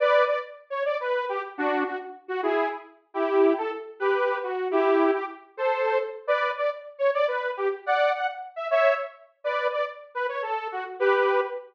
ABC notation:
X:1
M:6/8
L:1/8
Q:3/8=140
K:Bm
V:1 name="Lead 2 (sawtooth)"
[Bd]2 d z2 c | [M:5/8] d B2 G z | [M:6/8] [DF]2 F z2 F | [M:5/8] [E^G]2 z3 |
[M:6/8] [K:Em] [EG]3 A z2 | [M:5/8] [GB]3 F2 | [M:6/8] [EG]3 G z2 | [M:5/8] [Ac]3 z2 |
[M:6/8] [K:Bm] [Bd]2 d z2 c | [M:5/8] d B2 G z | [M:6/8] [df]2 f z2 e | [M:5/8] [ce]2 z3 |
[M:6/8] [Bd]2 d z2 B | [M:5/8] c A2 F z | [M:6/8] [GB]3 z3 |]